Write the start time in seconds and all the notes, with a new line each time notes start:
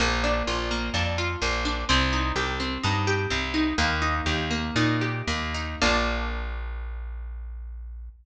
0.00 A#1 A#3
0.24 D4
0.47 A#1 F4
0.71 A#3
0.94 F2 D4
1.18 F4
1.42 A#1 A#3
1.65 D4
1.89 C2 C4
2.13 D#4
2.36 C2 G4
2.60 C4
2.83 G2 D#4
3.07 G4
3.30 C2 C4
3.54 D#4
3.78 D#2 A#3
4.02 D#4
4.26 D#2 G4
4.51 A#3
4.76 A#2 D#4
5.01 G4
5.27 D#2 A#3
5.54 D#4
5.82 A#1 A#3 D4 F4